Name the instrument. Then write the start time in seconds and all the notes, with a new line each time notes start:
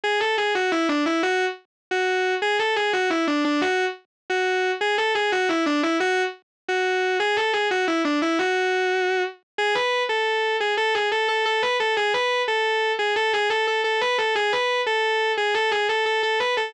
distortion guitar
0.04 G#4
0.20 A4
0.38 G#4
0.55 F#4
0.72 E4
0.89 D4
1.06 E4
1.23 F#4
1.91 F#4
2.42 G#4
2.59 A4
2.76 G#4
2.93 F#4
3.10 E4
3.27 D4
3.45 D4
3.61 F#4
4.30 F#4
4.81 G#4
4.98 A4
5.15 G#4
5.32 F#4
5.49 E4
5.66 D4
5.83 E4
6.00 F#4
6.68 F#4
7.20 G#4
7.37 A4
7.53 G#4
7.71 F#4
7.88 E4
8.05 D4
8.22 E4
8.39 F#4
9.58 G#4
9.75 B4
10.09 A4
10.60 G#4
10.77 A4
10.95 G#4
11.12 A4
11.28 A4
11.45 A4
11.62 B4
11.80 A4
11.97 G#4
12.14 B4
12.48 A4
12.99 G#4
13.16 A4
13.33 G#4
13.50 A4
13.67 A4
13.84 A4
14.01 B4
14.18 A4
14.35 G#4
14.53 B4
14.86 A4
15.37 G#4
15.54 A4
15.71 G#4
15.89 A4
16.06 A4
16.23 A4
16.40 B4
16.57 A4